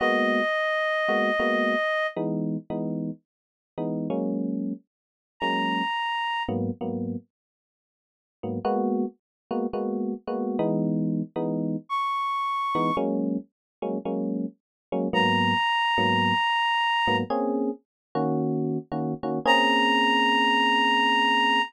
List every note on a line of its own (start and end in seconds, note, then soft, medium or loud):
0.00 0.41 G#3 medium
0.00 0.41 A#3 medium
0.00 0.41 B3 medium
0.00 0.41 F#4 medium
0.00 2.07 D#5 medium
1.08 1.31 G#3 medium
1.08 1.31 A#3 medium
1.08 1.31 B3 medium
1.08 1.31 F#4 medium
1.40 1.75 G#3 medium
1.40 1.75 A#3 medium
1.40 1.75 B3 medium
1.40 1.75 F#4 medium
2.16 2.57 E3 medium
2.16 2.57 G#3 medium
2.16 2.57 B3 medium
2.16 2.57 D#4 medium
2.70 3.11 E3 medium
2.70 3.11 G#3 medium
2.70 3.11 B3 medium
2.70 3.11 D#4 medium
3.78 4.08 E3 medium
3.78 4.08 G#3 medium
3.78 4.08 B3 medium
3.78 4.08 D#4 medium
4.10 4.73 F#3 medium
4.10 4.73 G#3 medium
4.10 4.73 A#3 medium
4.10 4.73 C#4 medium
5.40 5.82 F#3 medium
5.40 5.82 G#3 medium
5.40 5.82 A#3 medium
5.40 5.82 C#4 medium
5.40 6.43 A#5 medium
6.49 6.71 G#2 medium
6.49 6.71 F#3 medium
6.49 6.71 A#3 medium
6.49 6.71 B3 medium
6.81 7.16 G#2 medium
6.81 7.16 F#3 medium
6.81 7.16 A#3 medium
6.81 7.16 B3 medium
8.43 8.59 G#2 medium
8.43 8.59 F#3 medium
8.43 8.59 A#3 medium
8.43 8.59 B3 medium
8.65 9.05 G#3 medium
8.65 9.05 A#3 medium
8.65 9.05 B3 loud
8.65 9.05 F#4 loud
9.51 9.66 G#3 medium
9.51 9.66 A#3 medium
9.51 9.66 B3 medium
9.51 9.66 F#4 medium
9.73 10.14 G#3 medium
9.73 10.14 A#3 medium
9.73 10.14 B3 medium
9.73 10.14 F#4 medium
10.27 10.57 G#3 medium
10.27 10.57 A#3 medium
10.27 10.57 B3 medium
10.27 10.57 F#4 medium
10.59 11.22 E3 loud
10.59 11.22 G#3 loud
10.59 11.22 B3 medium
10.59 11.22 D#4 medium
11.36 11.76 E3 medium
11.36 11.76 G#3 medium
11.36 11.76 B3 medium
11.36 11.76 D#4 medium
11.89 12.96 C#6 medium
12.75 12.91 E3 medium
12.75 12.91 G#3 medium
12.75 12.91 B3 medium
12.75 12.91 D#4 medium
12.97 13.37 F#3 medium
12.97 13.37 G#3 medium
12.97 13.37 A#3 medium
12.97 13.37 C#4 medium
13.82 13.98 F#3 medium
13.82 13.98 G#3 medium
13.82 13.98 A#3 medium
13.82 13.98 C#4 medium
14.05 14.46 F#3 medium
14.05 14.46 G#3 medium
14.05 14.46 A#3 medium
14.05 14.46 C#4 medium
14.92 15.08 F#3 medium
14.92 15.08 G#3 medium
14.92 15.08 A#3 medium
14.92 15.08 C#4 medium
15.13 15.54 G#2 medium
15.13 15.54 F#3 loud
15.13 15.54 A#3 medium
15.13 15.54 B3 medium
15.13 17.16 A#5 medium
15.98 16.33 G#2 medium
15.98 16.33 F#3 medium
15.98 16.33 A#3 medium
15.98 16.33 B3 medium
17.07 17.23 G#2 medium
17.07 17.23 F#3 medium
17.07 17.23 A#3 medium
17.07 17.23 B3 medium
17.30 17.71 A#3 medium
17.30 17.71 C4 medium
17.30 17.71 C#4 medium
17.30 17.71 G#4 medium
18.15 18.78 D#3 medium
18.15 18.78 A#3 medium
18.15 18.78 C#4 medium
18.15 18.78 F#4 medium
18.92 19.14 D#3 medium
18.92 19.14 A#3 medium
18.92 19.14 C#4 medium
18.92 19.14 F#4 medium
19.23 19.39 D#3 medium
19.23 19.39 A#3 medium
19.23 19.39 C#4 medium
19.23 19.39 F#4 medium
19.45 21.60 A#3 loud
19.45 21.60 C4 loud
19.45 21.60 C#4 loud
19.45 21.60 G#4 loud
19.45 21.62 A#5 loud